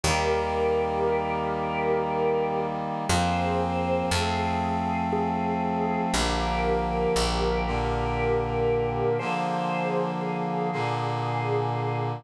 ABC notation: X:1
M:3/4
L:1/8
Q:1/4=59
K:Eb
V:1 name="Drawbar Organ"
[GB]6 | [Ac]2 A2 A2 | [GB]6 | [Ac]2 A2 A2 |]
V:2 name="Brass Section"
[E,G,B,]6 | [F,B,C]2 [F,=A,C]4 | [D,F,B,]3 [B,,D,B,]3 | [D,F,B,]3 [B,,D,B,]3 |]
V:3 name="Electric Bass (finger)" clef=bass
E,,6 | F,,2 F,,4 | B,,,2 B,,,4 | z6 |]